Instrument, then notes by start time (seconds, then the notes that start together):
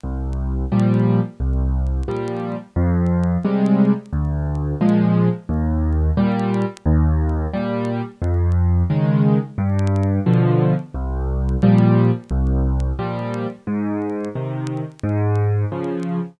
acoustic grand piano
0.04 C2
0.72 A#2 F3 G3
1.40 C2
2.08 A#2 F3 G3
2.76 F2
3.45 C3 G3 G#3
4.12 D2
4.81 A#2 F3 G#3
5.49 D#2
6.17 A#2 G3
6.86 D#2
7.53 A#2 G3
8.22 F2
8.90 C#3 D#3 G#3
9.58 G2
10.26 B2 D3 F3
10.94 C2
11.63 A#2 F3 G3
12.31 C2
12.99 A#2 F3 G3
13.67 G#2
14.35 C3 D#3
15.03 G#2
15.72 C#3 F3